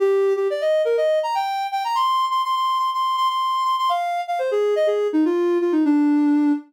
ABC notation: X:1
M:4/4
L:1/16
Q:1/4=123
K:Eb
V:1 name="Ocarina"
G3 G d e2 B e2 b g3 g b | c'3 c' c' c'2 c' c'2 c' c'3 c' c' | f3 f c A2 e A2 E F3 F E | D6 z10 |]